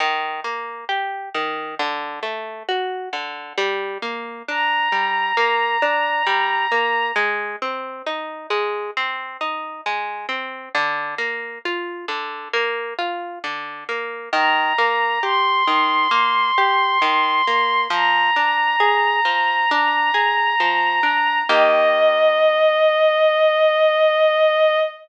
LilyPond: <<
  \new Staff \with { instrumentName = "Violin" } { \time 4/4 \key ees \major \tempo 4 = 67 r1 | r4 bes''2. | r1 | r1 |
bes''4 c'''2. | bes''1 | ees''1 | }
  \new Staff \with { instrumentName = "Orchestral Harp" } { \time 4/4 \key ees \major ees8 bes8 g'8 ees8 d8 a8 fis'8 d8 | g8 bes8 d'8 g8 bes8 d'8 g8 bes8 | aes8 c'8 ees'8 aes8 c'8 ees'8 aes8 c'8 | d8 bes8 f'8 d8 bes8 f'8 d8 bes8 |
ees8 bes8 g'8 ees8 bes8 g'8 ees8 bes8 | f8 d'8 aes'8 f8 d'8 aes'8 f8 d'8 | <ees bes g'>1 | }
>>